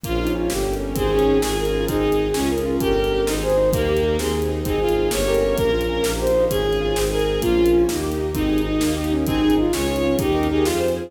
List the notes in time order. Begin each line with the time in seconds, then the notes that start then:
0.04 A#1 A#3 C#4 F4, kick, closed hi-hat
0.19 D#4 F4
0.27 closed hi-hat
0.35 C#4 F4
0.50 G1 A#3 C#4 G4, snare
0.66 G4
0.74 closed hi-hat
0.80 C#4
0.95 G#1 C4 D#4 G#4, kick, closed hi-hat
1.12 C#4 G#4
1.19 closed hi-hat
1.27 D#4
1.42 G#1 C#4 F4 G#4, snare
1.57 G#4 A#4
1.65 closed hi-hat
1.74 F4
1.88 G#1 C4 D#4 G#4, kick, closed hi-hat
2.03 G#4
2.12 closed hi-hat
2.19 D#4
2.34 C#2 C#4 F4 G#4, snare
2.50 G#4 A#4
2.58 closed hi-hat
2.66 F4
2.80 G1 C#4 G4 A#4, kick, closed hi-hat
2.96 A#4
3.04 closed hi-hat
3.12 G4
3.27 G#1 C4 D#4 G#4, snare
3.42 G#4 C5
3.50 closed hi-hat
3.58 D#4
3.73 D#2 A#3 D#4 G4 A#4, kick, closed hi-hat
3.88 G4
3.97 closed hi-hat
4.03 D#4
4.18 D#2 C4 D#4 G#4, snare
4.35 G#4
4.42 closed hi-hat
4.49 D#4
4.64 G#1 C4 D#4 G#4, kick, closed hi-hat
4.81 F4 G#4
4.89 closed hi-hat
4.95 D#4
5.11 G1 A#3 C#4 G4 C#5, snare
5.27 G4 A#4
5.35 closed hi-hat
5.41 C#4
5.57 A#1 A#3 C#4 F4 A#4, kick, closed hi-hat
5.73 F4
5.81 closed hi-hat
5.89 C#4
6.03 A#1 A#3 D#4 G4, snare
6.19 G4 C5
6.27 closed hi-hat
6.35 D#4
6.50 G#1 C#4 F4 G#4, kick, closed hi-hat
6.65 G#4
6.73 closed hi-hat
6.81 F4
6.95 G#1 C4 D#4 G#4, snare
7.11 G#4 A#4
7.20 closed hi-hat
7.26 D#4
7.41 A#1 A#3 C#4 F4, kick, closed hi-hat
7.57 F4
7.66 closed hi-hat
7.74 C#4
7.89 D#2 A#3 D#4 G4, snare
8.04 G4
8.12 closed hi-hat
8.19 D#4
8.34 G#1 C4 D#4 G#4, kick, closed hi-hat
8.49 G#4
8.58 closed hi-hat
8.65 D#4
8.80 D#2 A#3 D#4 G4, snare
8.97 G4
9.04 closed hi-hat
9.11 C#4 D#4
9.27 G#1 C4 D#4 G#4, kick, closed hi-hat
9.42 G#4
9.50 closed hi-hat
9.58 D#4 F4
9.73 C#2 C#4 F4 G#4 C#5, snare
9.88 G#4
9.96 closed hi-hat
10.03 C#4 F4
10.19 D#2 D#4 G4 A#4, kick, closed hi-hat
10.35 A#4
10.43 closed hi-hat
10.49 D#4 G4 G#4
10.66 F2 F4 G#4 C5, snare
10.81 C5
10.88 closed hi-hat
10.96 F4 G#4